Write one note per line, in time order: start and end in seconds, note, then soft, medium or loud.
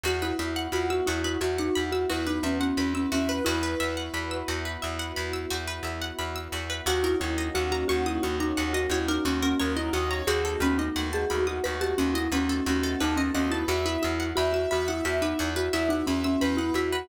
0.04 0.33 E2 medium
0.04 3.42 B3 medium
0.04 3.42 E4 medium
0.04 3.42 F#4 medium
0.04 0.20 F#4 medium
0.04 0.34 F#4 medium
0.04 0.22 F#4 loud
0.22 0.39 E4 medium
0.22 0.37 B4 medium
0.39 0.68 E2 medium
0.39 0.67 E4 medium
0.39 0.54 E5 medium
0.56 0.71 F#5 medium
0.72 1.01 E2 medium
0.72 0.88 F4 medium
0.72 1.03 F#4 medium
0.72 0.88 B5 medium
0.90 1.06 F#4 medium
0.90 1.06 E6 medium
1.06 1.37 E2 medium
1.06 1.23 E4 medium
1.06 1.23 F#4 medium
1.06 1.37 F#4 medium
1.24 1.41 E4 medium
1.24 1.40 B4 medium
1.41 1.70 E2 medium
1.41 1.57 F#4 medium
1.41 2.04 F#4 medium
1.41 1.57 E5 medium
1.58 1.90 D#4 medium
1.58 1.74 F#5 medium
1.75 2.06 E2 medium
1.75 1.91 B5 medium
1.92 2.08 F#4 medium
1.92 2.08 E6 medium
2.10 2.40 E2 medium
2.10 2.26 E4 medium
2.10 2.25 F#4 medium
2.10 2.38 B4 medium
2.27 2.43 D#4 medium
2.27 2.42 B4 medium
2.43 2.72 E2 medium
2.43 2.73 B3 medium
2.43 2.60 C#4 medium
2.43 2.59 E5 medium
2.60 2.77 C#4 medium
2.60 2.76 F#5 medium
2.77 3.06 E2 medium
2.77 2.93 C#4 medium
2.77 3.08 B4 medium
2.77 2.93 B5 medium
2.94 3.10 C#4 medium
2.94 3.10 E6 medium
3.12 3.41 E2 medium
3.12 3.42 C#4 medium
3.12 3.27 F#4 medium
3.12 3.28 E5 medium
3.29 3.44 B4 medium
3.29 3.45 B4 medium
3.45 3.75 E2 loud
3.45 6.85 B3 medium
3.45 5.44 E4 loud
3.45 6.85 E4 medium
3.45 3.61 F#4 medium
3.45 6.85 F#4 medium
3.45 5.20 B4 medium
3.63 3.78 B4 medium
3.80 4.09 E2 medium
3.80 3.95 E5 medium
3.97 4.12 F#5 medium
4.14 4.43 E2 medium
4.14 4.29 B5 medium
4.31 4.46 E6 medium
4.48 4.77 E2 medium
4.48 4.63 F#4 medium
4.65 4.81 B4 medium
4.82 5.12 E2 medium
4.82 4.98 E5 medium
4.99 5.15 F#5 medium
5.16 5.46 E2 medium
5.16 5.32 B5 medium
5.33 5.49 E6 medium
5.50 5.80 E2 medium
5.50 5.66 F#4 medium
5.67 5.83 B4 medium
5.83 6.12 E2 medium
5.83 6.00 E5 medium
6.02 6.17 F#5 medium
6.19 6.48 E2 medium
6.19 6.34 B5 medium
6.36 6.51 E6 medium
6.52 6.81 E2 medium
6.52 6.68 F#4 medium
6.70 6.85 B4 medium
6.86 7.15 D#2 loud
6.86 10.23 A#3 medium
6.86 10.23 C#4 medium
6.86 10.23 D#4 medium
6.86 10.23 F#4 medium
6.86 7.02 F#4 loud
6.86 7.16 F#4 medium
6.86 7.04 F#4 loud
7.04 7.20 E4 medium
7.04 7.19 A#4 medium
7.20 7.50 D#2 medium
7.20 7.48 E4 medium
7.20 7.36 C#5 medium
7.38 7.53 D#5 medium
7.55 7.84 D#2 medium
7.55 7.71 F#4 loud
7.55 7.83 F#4 medium
7.55 7.70 F#5 medium
7.72 7.87 F#4 loud
7.72 7.87 A#5 medium
7.88 8.19 D#2 medium
7.88 8.04 F#4 loud
7.88 8.20 F#4 medium
7.88 8.04 C#6 medium
8.06 8.22 E4 medium
8.06 8.21 D#6 medium
8.23 8.53 D#2 medium
8.23 8.39 F#4 medium
8.23 8.85 F#4 medium
8.23 8.38 C#6 medium
8.40 8.72 D#4 loud
8.40 8.56 A#5 medium
8.57 8.87 D#2 medium
8.57 8.73 F#5 medium
8.73 8.89 F#4 medium
8.73 8.90 D#5 medium
8.90 9.19 D#2 medium
8.90 9.08 E4 medium
8.90 9.21 F#4 medium
8.90 9.07 C#5 medium
9.08 9.25 D#4 loud
9.08 9.24 A#4 medium
9.25 9.54 D#2 medium
9.25 9.41 C#4 medium
9.25 9.41 F#4 medium
9.25 9.56 F#4 medium
9.42 9.60 C#4 loud
9.42 9.58 A#4 medium
9.60 9.90 D#2 medium
9.60 9.76 C#4 medium
9.60 9.90 A#4 medium
9.60 9.75 C#5 medium
9.76 9.93 E4 medium
9.76 9.92 D#5 medium
9.93 10.22 D#2 medium
9.93 10.21 F#4 medium
9.93 10.10 D#5 medium
9.93 10.09 F#5 medium
10.11 10.27 C#5 medium
10.11 10.26 A#5 medium
10.27 10.56 D#2 medium
10.27 13.65 A3 medium
10.27 13.65 B3 medium
10.27 13.65 D#4 medium
10.27 13.65 F#4 medium
10.27 10.43 F#4 medium
10.27 10.61 F#4 medium
10.27 10.61 G#4 loud
10.45 10.60 A4 medium
10.60 10.89 D#2 medium
10.60 10.78 C#4 loud
10.60 10.77 B4 medium
10.78 11.09 D#4 medium
10.78 10.94 D#5 medium
10.96 11.25 D#2 medium
10.96 11.24 F#4 medium
10.96 11.11 F#5 medium
11.13 11.44 G#4 loud
11.13 11.28 A5 medium
11.30 11.60 D#2 medium
11.30 11.58 F#4 medium
11.30 11.45 B5 medium
11.47 11.64 F#4 medium
11.47 11.62 D#6 medium
11.64 11.94 D#2 medium
11.64 12.23 F#4 medium
11.64 11.80 B4 loud
11.64 11.79 B5 medium
11.81 11.97 G4 loud
11.81 11.96 A5 medium
11.98 12.28 D#2 medium
11.98 12.14 C#4 medium
11.98 12.13 F#5 medium
12.14 12.30 E4 loud
12.14 12.31 D#5 medium
12.32 12.61 D#2 medium
12.32 12.49 C#4 medium
12.32 12.64 F#4 medium
12.32 12.48 B4 medium
12.49 12.65 C#4 medium
12.49 12.65 A4 medium
12.66 12.95 D#2 loud
12.66 13.00 C#4 medium
12.66 12.82 F#4 medium
12.66 12.99 F#4 medium
12.83 12.99 A4 medium
13.00 13.30 D#2 medium
13.00 13.17 D#4 loud
13.00 13.31 A4 medium
13.00 13.16 B4 medium
13.16 13.32 C#4 medium
13.16 13.33 D#5 medium
13.34 13.64 D#2 medium
13.34 13.50 C#4 loud
13.34 13.51 D#5 medium
13.34 13.50 F#5 medium
13.50 13.67 E4 loud
13.50 13.68 B4 medium
13.50 13.67 A5 medium
13.68 13.97 E2 loud
13.68 17.06 B3 medium
13.68 17.06 E4 medium
13.68 13.84 F#4 medium
13.68 13.85 F#4 loud
13.68 17.06 F#4 medium
13.68 14.02 E5 medium
13.85 14.02 E4 medium
13.85 14.01 B4 medium
14.02 14.33 E2 medium
14.02 14.31 E4 medium
14.02 14.18 E5 medium
14.20 14.35 F#5 medium
14.36 14.66 E2 medium
14.36 14.52 F#4 medium
14.36 14.69 E5 medium
14.36 14.52 B5 medium
14.53 14.69 F#4 medium
14.53 14.69 E6 medium
14.71 15.01 E2 medium
14.71 14.88 F#4 loud
14.71 15.04 E5 medium
14.71 14.86 B5 medium
14.88 15.05 E4 medium
14.88 15.03 F#5 medium
15.05 15.34 E2 medium
15.05 15.22 F#4 medium
15.05 15.20 E5 medium
15.05 15.67 E5 medium
15.22 15.51 D#4 medium
15.22 15.37 B4 medium
15.39 15.69 E2 medium
15.39 15.54 F#4 medium
15.56 15.73 F#4 loud
15.56 15.71 B4 medium
15.73 16.03 E2 medium
15.73 15.90 E4 loud
15.73 15.88 E5 medium
15.73 16.06 E5 medium
15.89 16.05 D#4 loud
15.89 16.06 F#5 medium
16.07 16.37 E2 medium
16.07 16.23 C#4 medium
16.07 16.35 E5 medium
16.07 16.23 B5 medium
16.24 16.40 C#4 loud
16.24 16.40 E6 medium
16.41 16.71 E2 medium
16.41 16.57 C#4 loud
16.41 16.74 B4 medium
16.41 16.57 B5 medium
16.57 16.73 E4 loud
16.57 16.74 F#5 medium
16.74 17.03 E2 medium
16.74 16.92 E4 medium
16.74 17.08 F#4 medium
16.74 16.91 E5 medium
16.92 17.08 F#4 medium
16.92 17.08 B4 medium